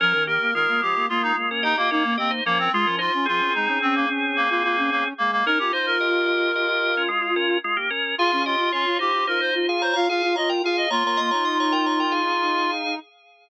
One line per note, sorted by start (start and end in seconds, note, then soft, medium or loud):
0.00 0.13 F3 medium
0.00 0.13 C#4 loud
0.00 0.24 A#4 loud
0.00 0.13 A#4 loud
0.13 0.38 D#3 medium
0.13 0.26 C#4 medium
0.13 0.26 A#4 loud
0.27 0.51 A#3 medium
0.27 0.51 G4 loud
0.27 0.54 A#4 medium
0.41 0.54 A#3 medium
0.54 0.67 D#3 medium
0.54 0.81 G#3 medium
0.54 0.81 F4 loud
0.54 0.81 A#4 loud
0.68 0.81 A#3 medium
0.82 0.95 F3 medium
0.82 1.06 G#3 medium
0.82 1.06 F4 medium
0.82 1.07 G4 medium
0.95 1.08 A#3 medium
1.09 1.22 G#3 medium
1.09 1.33 A#3 medium
1.09 1.22 F4 medium
1.23 1.49 G#3 medium
1.23 1.36 D#4 loud
1.23 1.49 F4 loud
1.36 1.74 A#3 medium
1.51 1.64 C#4 medium
1.51 1.64 A#4 medium
1.63 1.77 D#4 loud
1.63 1.76 G4 medium
1.63 1.76 D#5 loud
1.77 1.90 A#3 loud
1.77 1.90 F4 medium
1.77 1.90 G4 medium
1.77 1.90 D#5 loud
1.91 2.16 A#3 loud
1.91 2.14 C#4 medium
1.91 2.04 D#4 medium
1.91 2.14 A#4 medium
2.04 2.17 A#3 medium
2.18 2.41 A#3 medium
2.18 2.31 C4 medium
2.18 2.30 G4 medium
2.18 2.30 D#5 loud
2.31 2.44 D#4 medium
2.31 2.44 C5 medium
2.45 2.69 F3 medium
2.45 2.58 A#3 loud
2.45 2.70 C#4 medium
2.45 2.70 A#4 loud
2.59 2.72 C4 loud
2.73 2.85 G#3 medium
2.73 2.87 G#3 loud
2.73 2.96 F4 loud
2.73 2.87 F4 loud
2.86 3.09 F3 medium
2.86 3.00 C#4 medium
2.86 3.00 A#4 loud
2.99 3.12 D#4 medium
2.99 3.26 F4 medium
2.99 3.12 C5 loud
3.14 3.26 C#4 medium
3.26 3.41 F3 medium
3.26 5.08 C4 medium
3.26 3.53 F4 loud
3.26 5.08 G#4 loud
3.40 3.53 C#4 medium
3.54 3.68 G#3 medium
3.54 3.78 D#4 medium
3.68 3.81 C#4 medium
3.82 3.95 C4 loud
3.82 4.05 C#4 medium
3.95 4.08 A#3 loud
4.09 4.47 C#4 medium
4.36 4.49 A#3 loud
4.50 4.63 A#3 medium
4.50 4.63 F4 medium
4.64 4.90 A#3 medium
4.64 4.76 F4 medium
4.77 4.90 C#4 medium
4.91 5.04 A#3 loud
4.91 5.13 C#4 medium
5.18 5.43 G#3 medium
5.18 5.31 A#3 loud
5.32 5.45 A#3 loud
5.46 5.58 C#4 loud
5.46 5.59 D#4 medium
5.46 5.59 A#4 loud
5.46 5.58 A#4 loud
5.59 5.72 C#4 medium
5.59 5.72 F4 medium
5.59 5.72 G4 medium
5.59 5.72 A#4 medium
5.72 5.98 D#4 medium
5.72 7.58 F4 medium
5.72 5.86 C5 medium
5.72 5.98 C5 loud
5.86 7.02 A#4 loud
6.00 6.25 G4 medium
6.00 6.25 D#5 medium
6.26 6.51 G4 medium
6.26 6.51 D#5 loud
6.55 6.68 G4 medium
6.55 6.68 D#5 loud
6.69 6.95 G4 medium
6.69 6.95 D#5 loud
6.97 7.10 C#4 medium
6.97 7.10 A#4 loud
7.08 7.21 G#3 loud
7.08 7.21 F4 loud
7.22 7.35 G#3 medium
7.22 7.35 F4 medium
7.36 7.58 C#4 loud
7.36 7.58 A#4 loud
7.64 7.77 G#3 medium
7.64 7.77 F4 loud
7.77 7.90 A#3 medium
7.77 7.90 G4 medium
7.90 8.15 C#4 medium
7.90 8.15 A#4 loud
8.18 8.31 F4 medium
8.18 8.43 F4 loud
8.18 8.31 G#4 loud
8.18 8.31 F5 loud
8.32 8.56 C#4 medium
8.32 8.45 G#4 medium
8.32 8.45 F5 loud
8.45 8.72 F4 loud
8.45 8.70 G4 medium
8.45 8.70 D#5 loud
8.59 8.72 F4 medium
8.72 8.85 C#4 medium
8.72 8.98 F4 medium
8.72 8.97 F4 medium
8.72 8.98 C#5 medium
8.86 8.99 F4 medium
8.99 9.24 D#4 medium
8.99 9.13 F4 medium
8.99 9.26 G4 medium
8.99 9.24 C5 medium
9.14 9.27 F4 medium
9.27 9.40 D#4 medium
9.27 9.51 F4 medium
9.27 9.40 A#4 medium
9.27 9.40 C5 medium
9.40 9.66 D#4 medium
9.40 9.66 C5 loud
9.40 9.54 C5 medium
9.54 9.94 F4 medium
9.69 9.82 G#4 medium
9.69 9.82 F5 loud
9.82 9.95 C5 loud
9.82 9.93 C#5 medium
9.82 9.93 A#5 medium
9.93 10.08 F4 medium
9.93 10.06 C#5 loud
9.93 10.08 F5 loud
9.93 10.06 A#5 loud
10.09 10.22 F4 medium
10.09 10.33 G#4 loud
10.09 10.35 F5 loud
10.09 10.33 F5 loud
10.23 10.36 F4 medium
10.36 10.62 F4 medium
10.36 10.49 C#5 medium
10.36 10.49 D#5 loud
10.36 10.49 A#5 medium
10.49 10.62 A#4 medium
10.49 10.62 G5 loud
10.63 10.86 F4 medium
10.63 10.89 G#4 loud
10.63 10.77 F5 medium
10.63 10.89 F5 loud
10.77 10.90 D#5 loud
10.90 11.03 A#3 medium
10.90 12.71 F4 loud
10.90 11.03 C#5 loud
10.90 11.03 A#5 loud
11.04 11.17 A#3 medium
11.04 11.20 C#5 medium
11.04 11.20 A#5 loud
11.17 11.31 A#3 medium
11.17 11.30 D#5 loud
11.17 11.30 C6 loud
11.31 12.99 D#4 medium
11.31 11.44 C#5 medium
11.31 11.44 A#5 loud
11.45 11.58 D#5 medium
11.45 11.58 C6 loud
11.60 11.73 C#5 loud
11.60 11.73 A#5 loud
11.72 11.85 A#4 loud
11.72 11.85 G5 loud
11.86 11.99 C#5 medium
11.86 11.99 A#5 medium
12.00 12.13 A#4 medium
12.00 12.13 G5 medium
12.11 12.95 G#4 medium
12.11 12.95 F5 medium